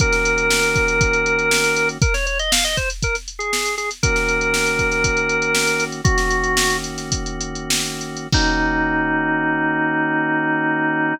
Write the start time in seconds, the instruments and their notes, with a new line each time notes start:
0.00 drawbar organ D#3 A#3 C#4 F#4 A#4, kick, closed hi-hat
0.13 snare, closed hi-hat
0.25 closed hi-hat
0.38 closed hi-hat
0.51 snare
0.63 closed hi-hat
0.76 kick, closed hi-hat
0.88 closed hi-hat
1.01 kick, closed hi-hat
1.13 closed hi-hat
1.26 closed hi-hat
1.39 closed hi-hat
1.51 snare
1.64 snare, closed hi-hat
1.76 closed hi-hat
1.89 closed hi-hat
2.02 drawbar organ A#4, kick, closed hi-hat
2.14 drawbar organ C#5, snare, closed hi-hat
2.26 drawbar organ C#5, closed hi-hat
2.39 drawbar organ D#5, closed hi-hat
2.52 drawbar organ F5, snare
2.64 drawbar organ D#5, closed hi-hat
2.77 drawbar organ C5, kick, closed hi-hat
2.90 closed hi-hat
3.03 drawbar organ A#4, kick, closed hi-hat
3.15 snare, closed hi-hat
3.28 closed hi-hat
3.39 drawbar organ G#4, closed hi-hat
3.53 snare
3.66 closed hi-hat
3.78 drawbar organ G#4, snare, closed hi-hat
3.91 snare, closed hi-hat
4.03 drawbar organ D#3 A#3 C#4 F#4 A#4, kick, closed hi-hat
4.16 snare, closed hi-hat
4.29 closed hi-hat
4.41 closed hi-hat
4.54 snare
4.66 closed hi-hat
4.79 kick, closed hi-hat
4.92 snare, closed hi-hat
5.04 kick, closed hi-hat
5.17 closed hi-hat
5.29 closed hi-hat
5.42 closed hi-hat
5.55 snare
5.67 closed hi-hat
5.80 snare, closed hi-hat
5.92 closed hi-hat
6.04 drawbar organ D#3 A#3 C#4 F#4, kick, closed hi-hat
6.18 snare, closed hi-hat
6.31 closed hi-hat
6.44 closed hi-hat
6.57 snare
6.70 closed hi-hat
6.84 closed hi-hat
6.98 snare, closed hi-hat
7.12 kick, closed hi-hat
7.26 closed hi-hat
7.41 closed hi-hat
7.55 closed hi-hat
7.70 snare
7.86 closed hi-hat
8.01 closed hi-hat
8.17 closed hi-hat
8.32 drawbar organ D#3 A#3 C#4 D#4 F#4, kick, crash